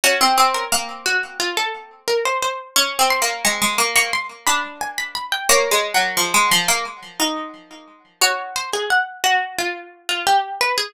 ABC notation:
X:1
M:4/4
L:1/16
Q:1/4=88
K:Gblyd
V:1 name="Pizzicato Strings"
G3 B3 G2 F =A3 B c c2 | d'2 c'2 d'3 d' c' z =b2 a b b =g | d16 | d2 c A g2 G2 F3 F =G2 =B A |]
V:2 name="Pizzicato Strings"
D C C2 B,6 z6 | (3D2 C2 B,2 A, A, B, B, z2 =D6 | (3B,2 A,2 G,2 F, A, F, B, z2 E6 | G8 z8 |]